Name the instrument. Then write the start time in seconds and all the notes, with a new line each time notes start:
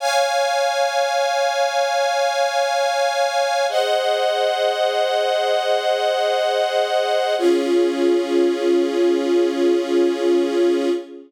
string ensemble 1
0.00 C#5 F5 G#5
3.69 G#4 C5 D#5 F#5
7.38 C#4 F4 G#4